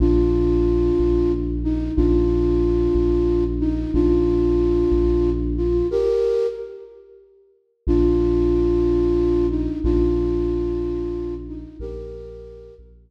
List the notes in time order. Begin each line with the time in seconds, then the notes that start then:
0.00 A#1 D4 F4
0.99 A#1
1.64 D#4
1.96 A#1 D4 F4
2.95 A#1
3.60 D#4
3.94 A#1 D4 F4
4.92 A#1
5.57 F4
5.91 G4 A#4
7.87 A#1 D4 F4
9.50 D#4
9.84 A#1 D4 F4
11.48 D#4
11.80 A#1 G4 A#4
12.79 A#1